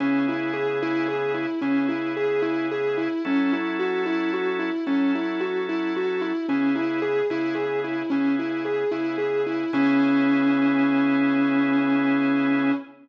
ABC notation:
X:1
M:12/8
L:1/8
Q:3/8=74
K:C#m
V:1 name="Distortion Guitar"
C E G E G E C E G E G E | C E F E F E C E F E F E | C E G E G E C E G E G E | C12 |]
V:2 name="Drawbar Organ"
[C,B,EG]6 [C,B,EG]6 | [F,CEA]6 [F,CEA]6 | [C,B,EG]3 [C,B,EG]3 [C,B,EG]3 [C,B,EG]3 | [C,B,EG]12 |]